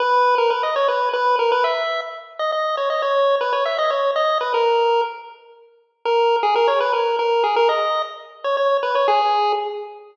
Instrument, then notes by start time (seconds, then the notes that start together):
lead 1 (square)
0.00 B4
0.38 A#4
0.50 B4
0.63 D#5
0.76 C#5
0.88 B4
1.13 B4
1.39 A#4
1.52 B4
1.64 E5
2.39 D#5
2.52 D#5
2.77 C#5
2.90 D#5
3.02 C#5
3.41 B4
3.53 C#5
3.65 E5
3.78 D#5
3.90 C#5
4.16 D#5
4.41 B4
4.54 A#4
6.05 A#4
6.43 G#4
6.55 A#4
6.68 C#5
6.80 B4
6.93 A#4
7.19 A#4
7.44 G#4
7.56 A#4
7.69 D#5
8.44 C#5
8.57 C#5
8.83 B4
8.95 C#5
9.08 G#4